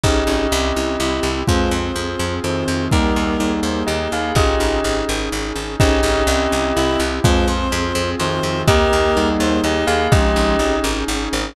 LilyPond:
<<
  \new Staff \with { instrumentName = "Tubular Bells" } { \time 3/4 \key aes \major \tempo 4 = 125 <g' ees''>2. | <aes f'>8 r4. <ees c'>4 | <g ees'>4 <g ees'>4 <g' ees''>8 <aes' f''>8 | <g' ees''>4. r4. |
<g' ees''>2. | <aes f'>8 r4. <ees c'>4 | <g' ees''>4 <g ees'>4 <g' ees''>8 <aes' f''>8 | <g' ees''>4. r4. | }
  \new Staff \with { instrumentName = "Clarinet" } { \time 3/4 \key aes \major des'8 des'4. e'4 | c''8 c''4. c''4 | <g' bes'>4. c''8 ees''4 | <f' aes'>4 r2 |
des'8 des'4. e'8 r8 | c''8 c''4. c''4 | <g' bes'>4. c''8 ees''4 | <f aes>4 r2 | }
  \new Staff \with { instrumentName = "Vibraphone" } { \time 3/4 \key aes \major <des' ees' aes'>4 c'8 e'8 g'8 e'8 | c'8 f'8 aes'8 f'8 c'8 f'8 | bes8 ees'8 aes'8 ees'8 bes8 ees'8 | des'8 ees'8 aes'8 ees'8 des'8 ees'8 |
<des' ees' aes'>4 c'8 e'8 g'8 e'8 | c'8 f'8 aes'8 f'8 c'8 f'8 | bes8 ees'8 aes'8 ees'8 bes8 ees'8 | des'8 ees'8 aes'8 ees'8 des'8 ees'8 | }
  \new Staff \with { instrumentName = "Electric Bass (finger)" } { \clef bass \time 3/4 \key aes \major aes,,8 aes,,8 c,8 c,8 c,8 c,8 | f,8 f,8 f,8 f,8 f,8 f,8 | ees,8 ees,8 ees,8 ees,8 ees,8 ees,8 | aes,,8 aes,,8 aes,,8 aes,,8 aes,,8 aes,,8 |
aes,,8 aes,,8 c,8 c,8 c,8 c,8 | f,8 f,8 f,8 f,8 f,8 f,8 | ees,8 ees,8 ees,8 ees,8 ees,8 ees,8 | aes,,8 aes,,8 aes,,8 aes,,8 aes,,8 aes,,8 | }
  \new Staff \with { instrumentName = "Brass Section" } { \time 3/4 \key aes \major <des' ees' aes'>4 <c' e' g'>2 | <c' f' aes'>2. | <bes ees' aes'>2. | <des' ees' aes'>2. |
<des' ees' aes'>4 <c' e' g'>2 | <c' f' aes'>2. | <bes ees' aes'>2. | <des' ees' aes'>2. | }
  \new DrumStaff \with { instrumentName = "Drums" } \drummode { \time 3/4 bd4 r4 r4 | bd4 r4 r4 | bd4 r4 r4 | bd4 r4 r4 |
bd4 r4 r4 | bd4 r4 r4 | bd4 r4 r4 | bd4 r4 r4 | }
>>